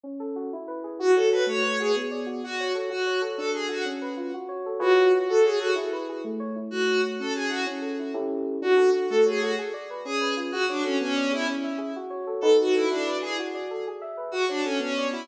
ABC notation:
X:1
M:6/8
L:1/8
Q:3/8=126
K:F#m
V:1 name="Violin"
z6 | F A B c2 G | z3 F2 z | F2 z A G F |
z6 | F2 z A G F | z6 | F2 z A G F |
z6 | F2 z A G F | z3 G2 z | F D C C2 E |
z6 | A F E D2 G | z6 | F D C C2 E |]
V:2 name="Electric Piano 2"
C A F E B G | F c A A, c F | B, d F F c A | F c A D A F |
C B ^E F c A | [^EGBc]3 F c A | E B G A, c E | A, c F C G E |
C A E [CE=GA]3 | D A F A, c F | G d B C B ^E | F c A B, d G |
C e G F c A | [^DFAB]3 E B G | F d A G e B | F c A B, d F |]